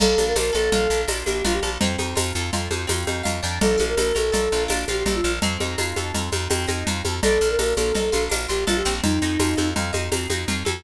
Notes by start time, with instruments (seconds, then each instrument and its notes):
0.00 electric bass (finger) A#1, acoustic guitar (steel) A#3, flute A4, crash, cowbell, low conga, shaker
0.18 electric bass (finger) A#1, acoustic guitar (steel) D4, high conga, shaker
0.27 flute A#4
0.36 electric bass (finger) A#1, acoustic guitar (steel) F4, flute A#4, tambourine, cowbell, high conga, shaker
0.53 electric bass (finger) A#1, acoustic guitar (steel) A4, flute A4, shaker
0.72 electric bass (finger) A#1, acoustic guitar (steel) F4, cowbell, low conga, shaker
0.90 electric bass (finger) A#1, acoustic guitar (steel) D4, shaker
1.08 electric bass (finger) A#1, acoustic guitar (steel) A#3, tambourine, cowbell, high conga, shaker
1.26 electric bass (finger) A#1, acoustic guitar (steel) D4, flute G4, high conga, shaker
1.44 electric bass (finger) A#1, acoustic guitar (steel) F4, flute F4, cowbell, low conga, shaker
1.54 flute G4
1.63 electric bass (finger) A#1, acoustic guitar (steel) A4, high conga, shaker
1.81 electric bass (finger) F2, acoustic guitar (steel) C4, cowbell, low conga, shaker
1.98 electric bass (finger) F2, acoustic guitar (steel) D#4, high conga, shaker
2.15 electric bass (finger) F2, acoustic guitar (steel) F4, tambourine, cowbell, high conga, shaker
2.35 electric bass (finger) F2, acoustic guitar (steel) A4, shaker
2.53 electric bass (finger) F2, acoustic guitar (steel) F4, cowbell, low conga, shaker
2.71 electric bass (finger) F2, acoustic guitar (steel) D#4, high conga, shaker
2.87 electric bass (finger) F2, acoustic guitar (steel) C4, tambourine, cowbell, high conga, shaker
3.07 electric bass (finger) F2, acoustic guitar (steel) D#4, high conga, shaker
3.23 electric bass (finger) F2, acoustic guitar (steel) F4, cowbell, low conga, shaker
3.43 electric bass (finger) F2, acoustic guitar (steel) D4, shaker
3.61 electric bass (finger) A#1, flute A4, cowbell, low conga, shaker
3.78 electric bass (finger) A#1, acoustic guitar (steel) F4, high conga, shaker
3.89 flute A#4
3.97 electric bass (finger) A#1, acoustic guitar (steel) A4, flute A#4, tambourine, cowbell, high conga, shaker
4.15 electric bass (finger) A#1, flute A4, acoustic guitar (steel) A#4, high conga, shaker
4.32 electric bass (finger) A#1, acoustic guitar (steel) A4, cowbell, low conga, shaker
4.52 electric bass (finger) A#1, acoustic guitar (steel) F4, shaker
4.68 electric bass (finger) A#1, acoustic guitar (steel) D4, tambourine, cowbell, high conga, shaker
4.88 electric bass (finger) A#1, acoustic guitar (steel) F4, flute G4, high conga, shaker
5.06 electric bass (finger) A#1, flute G4, acoustic guitar (steel) A4, cowbell, low conga, shaker
5.15 flute F4
5.24 electric bass (finger) A#1, acoustic guitar (steel) A#4, shaker
5.42 electric bass (finger) F2, acoustic guitar (steel) C4, cowbell, low conga, shaker
5.60 electric bass (finger) F2, acoustic guitar (steel) D#4, high conga, shaker
5.78 electric bass (finger) F2, acoustic guitar (steel) F4, tambourine, cowbell, high conga, shaker
5.96 electric bass (finger) F2, acoustic guitar (steel) A4, high conga, shaker
6.14 electric bass (finger) F2, acoustic guitar (steel) F4, cowbell, low conga, shaker
6.32 electric bass (finger) F2, acoustic guitar (steel) D#4, high conga, shaker
6.50 electric bass (finger) F2, acoustic guitar (steel) C4, tambourine, cowbell, high conga, shaker
6.67 electric bass (finger) F2, acoustic guitar (steel) D#4, high conga, shaker
6.87 electric bass (finger) F2, acoustic guitar (steel) F4, cowbell, low conga, shaker
7.05 electric bass (finger) F2, acoustic guitar (steel) A4, high conga, shaker
7.23 electric bass (finger) A#1, acoustic guitar (steel) D4, flute A4, cowbell, low conga, shaker
7.41 electric bass (finger) A#1, acoustic guitar (steel) F4, shaker
7.50 flute A#4
7.59 electric bass (finger) A#1, acoustic guitar (steel) A4, flute A#4, tambourine, cowbell, high conga, shaker
7.77 electric bass (finger) A#1, flute A4, acoustic guitar (steel) A#4, high conga, shaker
7.95 electric bass (finger) A#1, acoustic guitar (steel) A4, cowbell, low conga, shaker
8.12 electric bass (finger) A#1, acoustic guitar (steel) F4, high conga, shaker
8.29 electric bass (finger) A#1, acoustic guitar (steel) D4, tambourine, cowbell, high conga, shaker
8.48 electric bass (finger) A#1, acoustic guitar (steel) F4, flute G4, shaker
8.67 electric bass (finger) A#1, flute F4, acoustic guitar (steel) A4, cowbell, low conga, shaker
8.77 flute G4
8.85 electric bass (finger) A#1, acoustic guitar (steel) C4, shaker
9.04 electric bass (finger) F2, flute D#4, cowbell, low conga, shaker
9.22 electric bass (finger) F2, acoustic guitar (steel) D#4, shaker
9.39 electric bass (finger) F2, acoustic guitar (steel) F4, tambourine, cowbell, high conga, shaker
9.57 electric bass (finger) F2, acoustic guitar (steel) A4, high conga, shaker
9.76 electric bass (finger) F2, acoustic guitar (steel) F4, cowbell, low conga, shaker
9.93 electric bass (finger) F2, acoustic guitar (steel) D#4, high conga, shaker
10.12 electric bass (finger) F2, acoustic guitar (steel) C4, tambourine, cowbell, high conga, shaker
10.30 electric bass (finger) F2, acoustic guitar (steel) D#4, high conga, shaker
10.48 electric bass (finger) F2, acoustic guitar (steel) F4, cowbell, low conga, shaker
10.65 electric bass (finger) F2, acoustic guitar (steel) A4, high conga, shaker